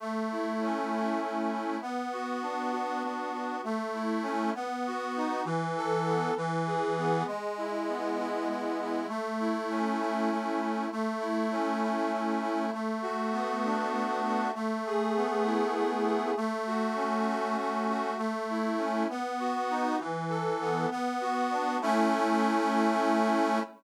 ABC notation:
X:1
M:6/8
L:1/8
Q:3/8=66
K:A
V:1 name="Accordion"
A, E C E A, E | B, F D F B, F | A, E C B, F ^D | E, A B, E, G B, |
G, E B, E G, E | A, E C E A, E | A, E C E A, E | A, F B, D A, F |
A, G B, E A, G | A, F C F A, F | A, E C B, F ^D | E, A B, B, F D |
[A,CE]6 |]